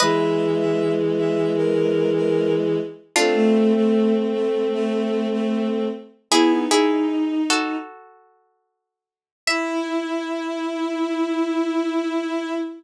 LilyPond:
<<
  \new Staff \with { instrumentName = "Harpsichord" } { \time 4/4 \key e \mixolydian \tempo 4 = 76 <b' dis''>1 | <d' f'>1 | <e' gis'>8 <e' gis'>4 <fis' a'>2~ <fis' a'>8 | e''1 | }
  \new Staff \with { instrumentName = "Violin" } { \time 4/4 \key e \mixolydian e''16 e''8 e''8 r16 e''8 bes'8. bes'8 r8. | a16 a8 a8 r16 a8 a8. a8 r8. | b8 dis'4. r2 | e'1 | }
  \new Staff \with { instrumentName = "Violin" } { \time 4/4 \key e \mixolydian <e gis>1 | <a c'>1 | e'16 dis'4~ dis'16 r2 r8 | e'1 | }
>>